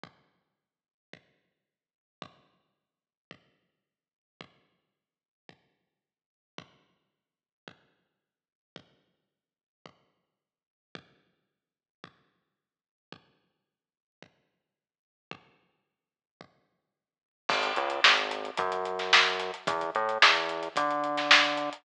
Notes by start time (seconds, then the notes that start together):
0.04 kick
1.13 kick
2.22 kick
3.31 kick
4.41 kick
5.49 kick
6.58 kick
7.68 kick
8.76 kick
9.86 kick
10.95 kick
12.04 kick
13.13 kick
14.23 kick
15.31 kick
16.41 kick
17.49 G#1, kick, crash
17.63 closed hi-hat
17.76 C#2, closed hi-hat
17.90 closed hi-hat
18.04 G#1, snare
18.18 closed hi-hat
18.31 closed hi-hat
18.45 closed hi-hat
18.57 F#2, kick, closed hi-hat
18.72 closed hi-hat
18.85 closed hi-hat
18.99 snare, closed hi-hat
19.13 snare
19.26 closed hi-hat
19.40 snare, closed hi-hat
19.54 closed hi-hat
19.67 E2, kick, closed hi-hat
19.81 closed hi-hat
19.95 A2, closed hi-hat
20.09 closed hi-hat
20.22 E2, snare
20.35 closed hi-hat
20.49 closed hi-hat
20.63 closed hi-hat
20.76 D3, kick, closed hi-hat
20.91 closed hi-hat
21.04 closed hi-hat
21.18 snare, closed hi-hat
21.31 snare
21.44 closed hi-hat
21.57 closed hi-hat
21.73 closed hi-hat